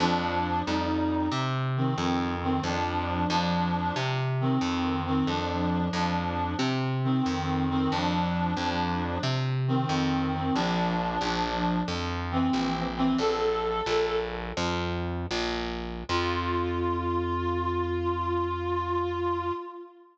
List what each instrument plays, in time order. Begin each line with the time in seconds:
0.00 electric bass (finger) F2, clarinet F3 D4
0.66 electric bass (finger) F2, clarinet G3 D#4
1.32 electric bass (finger) C3
1.77 clarinet D#3 C4
1.98 electric bass (finger) F2
2.43 clarinet D#3 C4
2.63 electric bass (finger) F2, clarinet F3 D4
3.30 electric bass (finger) F2, clarinet F3 D4
3.96 electric bass (finger) C3
4.41 clarinet D#3 C4
4.61 electric bass (finger) F2
5.06 clarinet D#3 C4
5.27 electric bass (finger) F2, clarinet F3 D4
5.93 electric bass (finger) F2, clarinet F3 D4
6.59 electric bass (finger) C3
7.04 clarinet D#3 C4
7.26 electric bass (finger) F2
7.70 clarinet D#3 C4
7.91 electric bass (finger) F2, clarinet F3 D4
8.57 electric bass (finger) F2, clarinet F3 D4
9.23 electric bass (finger) C3
9.68 clarinet D#3 C4
9.89 electric bass (finger) F2
10.34 clarinet D#3 C4
10.55 electric bass (finger) A#1, clarinet F3 D4
11.21 electric bass (finger) A#1, clarinet F3 D4
11.88 electric bass (finger) F2
12.31 clarinet E3 C4
12.53 electric bass (finger) A#1
12.97 clarinet E3 C4
13.18 electric bass (finger) A#1, clarinet A4
13.86 electric bass (finger) A#1
14.57 electric bass (finger) F2
15.31 electric bass (finger) A#1
16.09 electric bass (finger) F2, clarinet F4